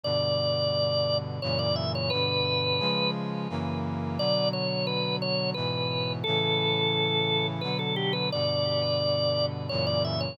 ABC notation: X:1
M:3/4
L:1/16
Q:1/4=87
K:Bm
V:1 name="Drawbar Organ"
d8 c d e c | B6 z6 | d2 c2 B2 c2 B4 | A8 B A G B |
d8 c d e c |]
V:2 name="Brass Section"
[G,,B,,D,]8 [F,,^A,,C,E,]4 | [G,,B,,D,]4 [C,^E,^G,]4 [F,,C,=E,^A,]4 | [B,,D,F,]8 [^G,,B,,E,]4 | [A,,C,E,]8 [B,,D,F,]4 |
[G,,B,,D,]8 [F,,^A,,C,E,]4 |]